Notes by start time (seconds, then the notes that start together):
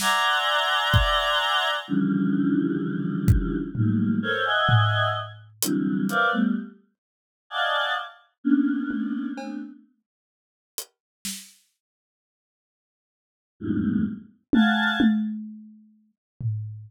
0.00 D5 E5 F#5 G#5 A#5 C6, snare
0.94 kick
1.88 C#3 D3 E3 F3 G3
3.28 kick
3.75 D#3 F3 F#3 G3 A3 A#3, floor tom
4.22 A4 A#4 C5 C#5
4.45 D#5 E5 F#5 G#5
4.69 floor tom
5.62 C3 D3 E3 F#3 G3, closed hi-hat
6.09 A#4 B4 C5 D5 E5 F5, closed hi-hat
6.32 G3 A3 B3
7.50 D5 D#5 F5 F#5 G#5 A5
8.44 A#3 B3 C#4 D4
8.91 high tom
9.38 A3 B3 C4 D4, cowbell
10.78 closed hi-hat
11.25 snare
13.60 E2 F2 G2 G#2 A2 B2
14.53 F5 F#5 G#5 A5, high tom
15.00 high tom
16.41 floor tom